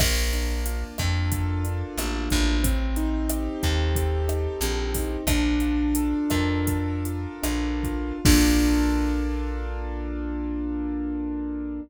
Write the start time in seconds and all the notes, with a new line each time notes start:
0.00 A#1 A#3, kick, cross-stick, crash
0.32 D4, closed hi-hat
0.66 F4, closed hi-hat
0.98 F2 A4, kick, cross-stick, closed hi-hat
1.32 F4, kick, closed hi-hat
1.64 D4, closed hi-hat
1.98 A1 A#3, cross-stick, closed hi-hat
2.30 A1 D4, kick, closed hi-hat
2.63 C4, kick, closed hi-hat
2.96 D#4, closed hi-hat
3.30 G4, cross-stick, closed hi-hat
3.62 D#2 A4, kick, closed hi-hat
3.95 G4, kick, closed hi-hat
4.28 D#4, cross-stick, closed hi-hat
4.61 A#1 C4, closed hi-hat
4.95 D#4, kick, open hi-hat
5.27 A#1 D4, kick, cross-stick, closed hi-hat
5.60 F4, closed hi-hat
5.95 A4, closed hi-hat
6.30 F2 A#4, kick, cross-stick, closed hi-hat
6.67 A4, kick, closed hi-hat
7.05 F4, closed hi-hat
7.42 A#1 D4, cross-stick, closed hi-hat
7.83 F4, kick, closed hi-hat
8.25 A#1 A#3 D4 F4 A4, kick, crash